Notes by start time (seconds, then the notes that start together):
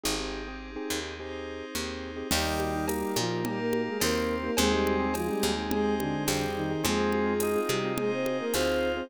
0.04 G#1 C4 D#4 G4 G#4
0.19 C4 D#4 G4 G#4
0.48 C4 D#4 G4 G#4
0.76 C4 D#4 G4 G#4
0.90 D#2
1.03 C4 D#4 G4 G#4
1.17 C4 D#4 G4 G#4 C5
1.75 D#2 C4 D#4 G4 G#4
2.16 C4 D#4 G4 G#4
2.30 D#2 D#3 G3 A#3 D#4 G4, crash, cowbell, low conga
2.46 A#3 D#4 G4
2.60 high conga
2.75 A#3 D#4 G4
2.88 A#3, tambourine, cowbell, high conga
3.02 A#3 D#4 G4
3.16 A#2 F3 F4, high conga
3.30 A#3 D#4 G4
3.43 G3 A#3 D#4 G4 A#4, cowbell, low conga
3.59 A#3 A#4
3.73 high conga
3.87 G#3 G#4
4.00 D#2 A#3 C4 D#4 G4 A#4, tambourine, cowbell, high conga
4.44 A#3 D#4 G4 A#4
4.57 D#2 G#3 C4 D#4 G4 G#4, cowbell, low conga
4.71 G3 C4 D#4 G4 G#4
4.87 high conga
4.99 C4 D#4 G4 G#4
5.14 F3 G#3 F4, tambourine, cowbell, high conga
5.28 G3 C4 D#4 G4 G#4
5.43 D#2, high conga
5.57 C4 D#4 G4 G#4
5.70 G#3 C4 D#4 G4 G#4 C5, cowbell, low conga
5.99 D3 D4, high conga
6.27 F2 G3 C4 D#4 G4 G#4, tambourine, cowbell, high conga
6.56 D#3 D#4
6.71 C4 D#4 G4 G#4
6.84 F2 G#3 C4 D#4 F4 G#4, cowbell, low conga
6.98 C4 D#4 F4 G#4
7.12 high conga
7.26 C4 D#4 F4 G#4
7.40 D#4, tambourine, cowbell, high conga
7.56 C4 D#4 F4 G#4
7.68 C3 G3 G4, high conga
7.84 C4 D#4 F4 G#4
7.98 G#3 C4 D#4 F4 G#4 C5, cowbell, low conga
8.12 C4 C5
8.26 high conga
8.40 A#3 A#4
8.54 D2 C4 D#4 F4 G#4 C5, tambourine, cowbell, high conga
8.96 C4 D#4 F4 G#4 C5